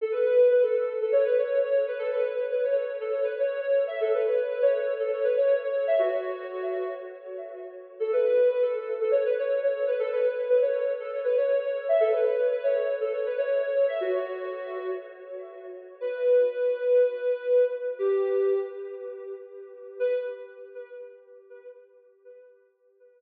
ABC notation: X:1
M:4/4
L:1/16
Q:1/4=120
K:Bm
V:1 name="Ocarina"
A B B2 B A3 A c B c2 c2 B | A B B2 B c3 A c B c2 c2 e | A B B2 B c3 A c B c2 c2 e | F8 z8 |
A B B2 B A3 A c B c2 c2 B | A B B2 B c3 A c B c2 c2 e | A B B2 B c3 A c B c2 c2 e | F8 z8 |
B16 | G6 z10 | B4 z12 |]